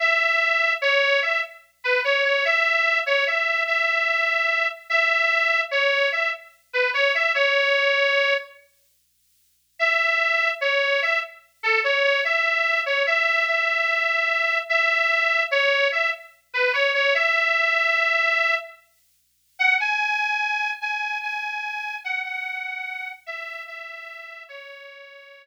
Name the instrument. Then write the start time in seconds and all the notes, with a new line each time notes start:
harmonica
0.00 E5
0.82 C#5
1.22 E5
1.84 B4
2.04 C#5
2.24 C#5
2.45 E5
3.06 C#5
3.27 E5
3.67 E5
4.90 E5
5.71 C#5
6.12 E5
6.73 B4
6.94 C#5
7.15 E5
7.35 C#5
9.79 E5
10.61 C#5
11.02 E5
11.63 A4
11.84 C#5
12.04 C#5
12.24 E5
12.86 C#5
13.06 E5
13.47 E5
14.69 E5
15.51 C#5
15.92 E5
16.54 B4
16.73 C#5
16.94 C#5
17.14 E5
19.59 F#5
19.80 G#5
20.81 G#5
21.23 G#5
22.04 F#5
22.24 F#5
23.26 E5
23.67 E5
24.49 C#5